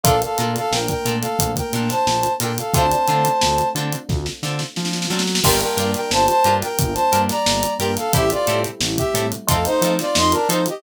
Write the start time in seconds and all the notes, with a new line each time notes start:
0.04 A#1 A3 A#3 D4 F4 A4 A#4 F5, kick, closed hi-hat
0.22 A4 F5, closed hi-hat
0.38 A#2 D4 F4 A4 A#4, closed hi-hat
0.56 A4 F5, closed hi-hat
0.71 A#1 A#4 G5, snare
0.88 A#4 G5, kick, closed hi-hat
1.05 A#2 D4 F4 A4 A#4, closed hi-hat
1.21 A4 F5, closed hi-hat
1.39 A#1, kick, closed hi-hat
1.56 A#4 G5, kick, closed hi-hat
1.73 A#2 D4 F4 A4 A#4, closed hi-hat
1.89 C5 A5, snare, closed hi-hat
2.07 A#1, snare
2.23 closed hi-hat
2.40 A#2 D4 F4 A4 A#4 G5, closed hi-hat
2.58 A4 F5, closed hi-hat
2.73 D2 A3 C4 D4 F4 A4 C5 A5, kick, closed hi-hat
2.91 closed hi-hat
3.07 D3 C4 D4 F4 A4, closed hi-hat
3.25 closed hi-hat
3.41 D2, snare
3.58 closed hi-hat
3.75 D3 C4 D4 F4 A4, closed hi-hat
3.92 closed hi-hat
4.09 D2, kick, snare
4.26 snare
4.43 D3 C4 D4 F4 A4, snare
4.59 snare
4.76 F3, snare
4.85 snare
4.93 snare
5.02 snare
5.10 F#3 C4 D4 F4 A4, snare
5.19 snare
5.27 snare
5.35 snare
5.44 G1 G3 A#3 D4 F4 G4 A#4 G5, kick, crash
5.61 A#4 G5, closed hi-hat
5.77 G2 D4 F4 G4 A#4, closed hi-hat
5.94 A#4 G5, snare, closed hi-hat
6.11 G1 C5 A5, snare
6.27 C5 A5, closed hi-hat
6.44 G2 D4 F4 G4 A#4, closed hi-hat
6.62 A#4 G5, snare, closed hi-hat
6.79 G1, kick, closed hi-hat
6.94 C5 A5, closed hi-hat
7.12 G2 D4 F4 G4 A#4, closed hi-hat
7.29 D5 A#5, snare, closed hi-hat
7.46 G1, snare
7.63 closed hi-hat
7.79 G2 D4 F4 G4 A#4 G5, closed hi-hat
7.97 A4 F5, snare, closed hi-hat
8.13 A1 G3 A3 C4 E4 G4 A4 E5, kick, closed hi-hat
8.30 F4 D5, closed hi-hat
8.47 A2 C4 E4 G4 A4, closed hi-hat
8.64 closed hi-hat
8.80 A1, snare
8.97 G4 E5, kick, closed hi-hat
9.14 A2 C4 E4 G4 A4, closed hi-hat
9.32 closed hi-hat
9.47 F2 A3 C4 D#4 F4 A4 F5, kick, closed hi-hat
9.65 D#4 C5, closed hi-hat
9.81 F3 C4 D#4 F4 A4, closed hi-hat
9.99 F4 D5, snare, closed hi-hat
10.15 F2 D#5 C6, snare
10.32 D4 A#4, closed hi-hat
10.48 F3 C4 D#4 F4 A4 C5, closed hi-hat
10.66 G4 D#5, closed hi-hat